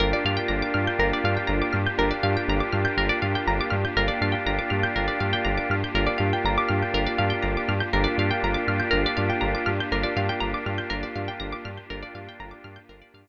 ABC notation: X:1
M:4/4
L:1/16
Q:1/4=121
K:Gm
V:1 name="Drawbar Organ"
[B,DFG]16 | [B,DFG]16 | [B,DFG]16 | [B,DFG]16 |
[B,DFG]16 | [B,DFG]16 | [B,DFG]8 [B,DFG]8 |]
V:2 name="Pizzicato Strings"
B d f g b d' f' g' B d f g b d' f' g' | B d f g b d' f' g' B d f g b d' f' g' | B d f g b d' f' g' B d f g b d' f' g' | B d f g b d' f' g' B d f g b d' f' g' |
B d f g b d' f' g' B d f g b d' f' g' | B d f g b d' f' g' B d f g b d' f' g' | B d f g b d' f' g' B d f g z4 |]
V:3 name="Synth Bass 1" clef=bass
G,,,2 G,,2 G,,,2 G,,2 G,,,2 G,,2 G,,,2 G,,2 | G,,,2 G,,2 G,,,2 G,,2 G,,,2 G,,2 G,,,2 G,,2 | G,,,2 G,,2 G,,,2 G,,2 G,,,2 G,,2 G,,,2 G,,2 | G,,,2 G,,2 G,,,2 G,,2 G,,,2 G,,2 G,,,2 G,,2 |
G,,,2 G,,2 G,,,2 G,,2 G,,,2 G,,2 G,,,2 G,,2 | G,,,2 G,,2 G,,,2 G,,2 G,,,2 G,,2 G,,,2 G,,2 | G,,,2 G,,2 G,,,2 G,,2 G,,,2 G,,2 z4 |]
V:4 name="Pad 5 (bowed)"
[B,DFG]16- | [B,DFG]16 | [B,DFG]16- | [B,DFG]16 |
[B,DFG]16- | [B,DFG]16 | [B,DFG]16 |]